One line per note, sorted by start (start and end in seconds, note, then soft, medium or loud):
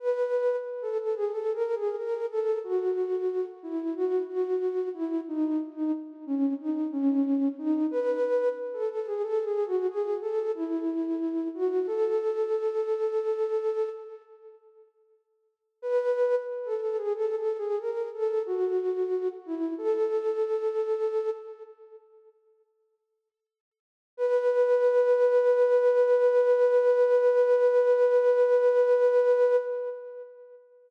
0.00 0.56 B4 medium
0.82 0.98 A4 medium
0.99 1.15 A4 medium
1.15 1.31 G#4 medium
1.32 1.53 A4 medium
1.54 1.75 A#4 medium
1.75 1.96 G#4 medium
1.98 2.26 A#4 medium
2.30 2.59 A4 medium
2.64 3.45 F#4 medium
3.63 3.94 E4 medium
3.95 4.22 F#4 medium
4.29 4.89 F#4 medium
4.94 5.21 E4 medium
5.28 5.60 D#4 medium
5.76 5.92 D#4 medium
6.26 6.54 C#4 medium
6.60 6.88 D#4 medium
6.92 7.48 C#4 medium
7.59 7.87 D#4 medium
7.91 8.49 B4 medium
8.74 8.89 A4 medium
8.91 9.06 A4 medium
9.07 9.22 G#4 medium
9.23 9.44 A4 medium
9.45 9.66 G#4 medium
9.66 9.87 F#4 medium
9.89 10.17 G#4 medium
10.21 10.52 A4 medium
10.55 11.48 E4 medium
11.55 11.86 F#4 medium
11.87 13.89 A4 medium
15.82 16.35 B4 medium
16.65 16.80 A4 medium
16.81 16.97 A4 medium
16.97 17.13 G#4 medium
17.14 17.35 A4 medium
17.36 17.57 A4 medium
17.58 17.79 G#4 medium
17.80 18.08 A#4 medium
18.14 18.43 A4 medium
18.46 19.28 F#4 medium
19.46 19.74 E4 medium
19.78 21.30 A4 medium
24.17 29.56 B4 loud